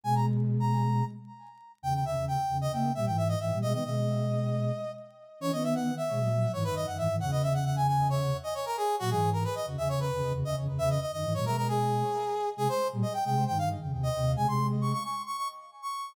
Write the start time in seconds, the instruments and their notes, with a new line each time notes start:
0.03 flute B2 G#3, brass section G#5
0.15 brass section A#5
0.60 brass section A#5
1.82 flute E2 C#3, brass section G5
1.94 brass section G5
2.05 flute E2 C#3, brass section E5
2.16 flute E2 C#3
2.28 brass section G5
2.49 flute E2 C#3
2.61 brass section D#5
2.72 flute C#3 A#3, brass section G5
2.95 flute A#2 G3, brass section E5
3.06 flute G#2 E3, brass section G5
3.17 brass section E5
3.28 brass section D#5
3.40 flute G#2 E3, brass section E5
3.52 flute A#2 G3
3.62 flute B2 G#3, brass section D#5
3.72 flute D#3 B3, brass section D#5
3.84 flute B2 G#3, brass section D#5
5.40 flute E3 C#4, brass section C#5
5.52 flute D#3 B3, brass section D#5
5.63 brass section E5
5.75 brass section F#5
5.97 brass section E5
6.09 flute B2 G#3
6.18 flute A#2 F#3
6.53 flute G#2 E3, brass section C#5
6.64 flute F#2 D#3, brass section B4
6.75 flute F#2 D#3, brass section D#5
6.87 flute F#2 D#3, brass section F#5
6.97 flute G#2 E3, brass section E5
7.09 flute G#2 E3
7.20 flute E2 C#3, brass section F#5
7.31 brass section D#5
7.43 brass section E5
7.54 brass section F#5
7.65 brass section F#5
7.76 brass section G#5
7.87 brass section G#5
8.10 brass section C#5
8.43 brass section D#5
8.54 brass section C#5
8.66 brass section A#4
8.77 brass section G#4
8.99 flute A#2 F#3, brass section F#4
9.10 flute G#2 E3, brass section G#4
9.33 brass section A#4
9.44 brass section B4
9.55 brass section D#5
9.66 flute E2 C#3
9.78 flute E2 C#3, brass section E5
9.89 brass section C#5
10.00 brass section B4
10.12 flute E2 C#3
10.23 flute E2 C#3
10.33 flute E2 C#3
10.44 flute E2 C#3, brass section D#5
10.57 flute E2 C#3
10.69 flute E2 C#3
10.78 flute E2 C#3, brass section E5
10.90 brass section D#5
11.01 brass section D#5
11.12 flute F#2 D#3, brass section D#5
11.24 flute G#2 E3
11.34 flute A#2 F#3, brass section C#5
11.45 flute B2 G#3, brass section A#4
11.57 brass section A#4
11.68 brass section G#4
12.57 flute C3 G#3, brass section G#4
12.69 brass section C5
12.92 flute A#2 G3
13.02 brass section D#5
13.13 brass section G5
13.25 flute C3 G#3, brass section G5
13.47 flute G2 D#3, brass section G5
13.58 brass section F5
13.82 flute F2 C#3
13.92 flute D#2 C3
14.03 brass section D#5
14.16 flute D#2 C3
14.35 flute C3 G#3, brass section G#5
14.46 flute C3 G#3, brass section C6
14.81 brass section C#6
14.93 brass section C#6
15.04 brass section C#6
15.26 brass section C#6
15.37 brass section C#6
15.82 brass section C#6